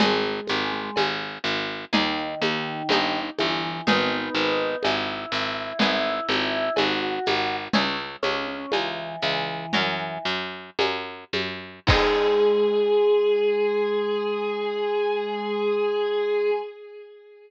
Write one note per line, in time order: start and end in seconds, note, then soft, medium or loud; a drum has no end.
0.00 0.40 G#1 medium
0.00 0.63 G#3 medium
0.00 1.75 B3 loud
0.00 1.75 D#4 loud
0.00 1.75 G#4 loud
0.00 cowbell medium
0.00 low conga loud
0.00 shaker medium
0.47 0.91 G#1 medium
0.47 high conga medium
0.47 shaker medium
0.73 0.96 G#3 medium
0.96 1.38 G#1 medium
0.96 cowbell medium
0.96 high conga medium
0.96 shaker medium
1.44 1.85 G#1 medium
1.44 shaker medium
1.93 2.35 D#2 medium
1.93 3.20 D#3 medium
1.93 2.80 A#3 loud
1.93 2.80 D#4 loud
1.93 2.80 G#4 loud
1.93 cowbell medium
1.93 low conga medium
1.93 shaker medium
2.42 2.83 D#2 medium
2.42 high conga medium
2.42 shaker medium
2.89 3.30 G1 medium
2.89 3.79 A#3 loud
2.89 3.79 D#4 loud
2.89 3.79 G4 medium
2.89 cowbell medium
2.89 high conga medium
2.89 shaker medium
3.38 3.81 G1 medium
3.38 3.81 E3 medium
3.38 high conga medium
3.38 shaker medium
3.87 4.29 G#1 medium
3.87 5.61 B3 loud
3.87 4.77 B3 medium
3.87 5.61 D#4 loud
3.87 4.77 D#4 medium
3.87 5.61 G#4 loud
3.87 cowbell medium
3.87 low conga medium
3.87 shaker medium
4.34 4.76 G#1 medium
4.34 shaker medium
4.83 5.26 G#1 medium
4.83 6.72 E4 medium
4.83 cowbell medium
4.83 high conga medium
4.83 shaker medium
5.32 5.73 G#1 medium
5.32 shaker medium
5.79 6.20 G#1 medium
5.79 7.56 B3 loud
5.79 7.56 E4 medium
5.79 7.56 G#4 loud
5.79 cowbell medium
5.79 low conga medium
5.79 shaker medium
6.29 6.70 G#1 medium
6.29 high conga medium
6.29 shaker medium
6.76 7.19 G#1 medium
6.76 7.56 F#4 medium
6.76 cowbell medium
6.76 high conga medium
6.76 shaker medium
7.26 7.68 G#1 medium
7.26 high conga medium
7.26 shaker medium
7.73 8.16 C#2 medium
7.73 7.97 C#4 loud
7.73 9.53 C#4 medium
7.73 9.53 E4 loud
7.73 9.53 G#4 loud
7.73 cowbell medium
7.73 low conga medium
7.73 shaker medium
8.23 8.66 C#2 medium
8.23 8.46 C#4 medium
8.23 high conga medium
8.23 shaker medium
8.48 8.71 C#4 medium
8.72 9.16 C#2 medium
8.72 9.17 E3 medium
8.72 cowbell medium
8.72 high conga medium
8.72 shaker medium
9.22 9.66 C#2 medium
9.22 10.18 E3 medium
9.22 shaker medium
9.73 10.18 F#2 medium
9.73 11.65 C#4 loud
9.73 11.65 F#4 medium
9.73 11.65 A#4 loud
9.73 cowbell medium
9.73 low conga medium
9.73 shaker medium
10.25 10.70 F#2 medium
10.25 shaker medium
10.79 11.24 F#2 medium
10.79 cowbell medium
10.79 high conga medium
10.79 shaker medium
11.33 11.80 F#2 medium
11.33 high conga medium
11.33 shaker medium
11.87 16.51 G#2 loud
11.87 16.51 G#3 loud
11.87 16.53 B3 loud
11.87 16.53 D#4 loud
11.87 16.50 G#4 loud
11.87 16.53 G#4 loud
11.87 kick loud
11.87 crash loud